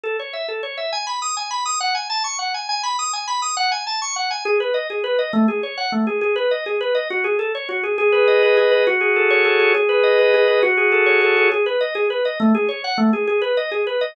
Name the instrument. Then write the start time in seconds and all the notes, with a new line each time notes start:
drawbar organ
0.03 A4
0.19 C#5
0.33 E5
0.48 A4
0.63 C#5
0.77 E5
0.92 G#5
1.07 B5
1.22 D#6
1.37 G#5
1.51 B5
1.66 D#6
1.80 F#5
1.95 G#5
2.10 A5
2.24 C#6
2.39 F#5
2.54 G#5
2.69 G#5
2.83 B5
2.99 D#6
3.13 G#5
3.27 B5
3.42 D#6
3.57 F#5
3.72 G#5
3.87 A5
4.02 C#6
4.16 F#5
4.31 G#5
4.45 G#4
4.60 B4
4.74 D#5
4.90 G#4
5.04 B4
5.19 D#5
5.33 A3
5.48 G#4
5.63 C#5
5.77 F#5
5.92 A3
6.07 G#4
6.21 G#4
6.36 B4
6.51 D#5
6.66 G#4
6.81 B4
6.95 D#5
7.10 F#4
7.24 G#4
7.39 A4
7.55 C#5
7.69 F#4
7.83 G#4
7.98 G#4
8.12 B4
8.28 D#5
8.43 B4
8.57 G#4
8.71 B4
8.87 F#4
9.01 G#4
9.16 A4
9.30 C#5
9.45 A4
9.60 G#4
9.75 G#4
9.89 B4
10.03 D#5
10.19 B4
10.34 G#4
10.48 B4
10.63 F#4
10.77 G#4
10.92 A4
11.06 C#5
11.22 A4
11.37 G#4
11.52 G#4
11.66 B4
11.81 D#5
11.95 G#4
12.10 B4
12.25 D#5
12.40 A3
12.55 G#4
12.69 C#5
12.84 F#5
12.98 A3
13.13 G#4
13.27 G#4
13.42 B4
13.57 D#5
13.71 G#4
13.87 B4
14.01 D#5